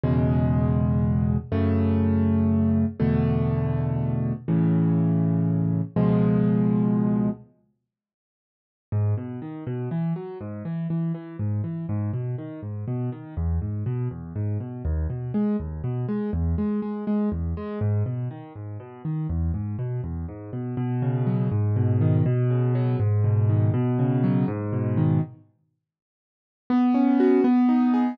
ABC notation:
X:1
M:6/8
L:1/8
Q:3/8=81
K:C#m
V:1 name="Acoustic Grand Piano"
[E,,B,,C,G,]6 | [F,,C,A,]6 | [E,,B,,=D,A,]6 | [A,,C,E,]6 |
[C,,B,,^E,G,]6 | z6 | [K:G#m] G,, B,, D, B,, E, F, | G,, E, E, E, G,, E, |
G,, B,, D, G,, B,, D, | E,, G,, B,, E,, G,, B,, | D,, B,, G, D,, B,, G, | E,, G, G, G, E,, G, |
G,, B,, D, G,, B,, D, | E,, G,, B,, E,, G,, B,, | [K:B] B,, C, F, G,, B,, D, | B,, C, F, G,, B,, D, |
B,, C, F, G,, B,, D, | z6 | B, C F B, D G |]